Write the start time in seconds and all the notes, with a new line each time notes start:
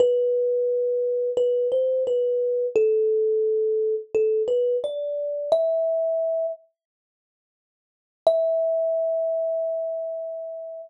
0.00 B4
1.37 B4
1.72 C5
2.07 B4
2.76 A4
4.15 A4
4.48 B4
4.84 D5
5.52 E5
8.27 E5